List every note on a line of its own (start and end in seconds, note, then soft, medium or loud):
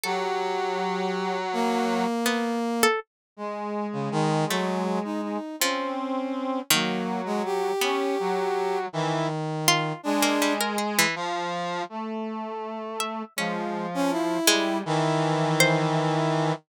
0.04 2.04 F#3 loud
0.04 1.38 G4 medium
0.04 1.37 A4 medium
1.53 2.86 A#3 loud
2.26 2.59 B3 medium
2.83 3.00 A4 loud
3.37 3.87 G#3 medium
3.37 5.38 G#3 medium
3.93 4.09 C#3 medium
4.12 4.45 D#3 loud
4.49 4.99 F#3 medium
4.49 5.50 A3 medium
5.04 5.21 D#4 medium
5.23 5.56 D#4 medium
5.60 5.95 F3 medium
5.60 6.60 C4 medium
5.60 6.60 C#4 medium
6.71 7.71 D#3 loud
6.71 7.71 F#3 medium
6.71 7.21 A#3 medium
7.26 7.42 G#3 medium
7.45 8.78 G4 loud
7.81 8.81 B3 medium
7.81 8.16 C#4 medium
8.19 8.86 F#3 medium
8.93 9.93 D#3 medium
8.93 9.27 E3 loud
9.68 10.01 F4 loud
10.03 11.05 G#3 medium
10.03 10.53 D4 loud
10.23 10.39 A#3 medium
10.42 10.58 G3 medium
10.61 10.77 A#4 medium
10.78 10.95 G#4 medium
10.99 11.15 E3 loud
11.16 11.82 F3 loud
11.89 13.23 A3 medium
13.00 13.33 E5 medium
13.36 14.38 F3 medium
13.36 13.86 G#3 medium
13.36 14.38 C#4 medium
13.94 14.11 C#4 loud
14.11 14.78 E4 loud
14.47 14.82 G3 medium
14.47 15.47 G#3 loud
14.86 16.52 D#3 loud
14.86 16.52 E3 loud
15.60 16.60 C5 loud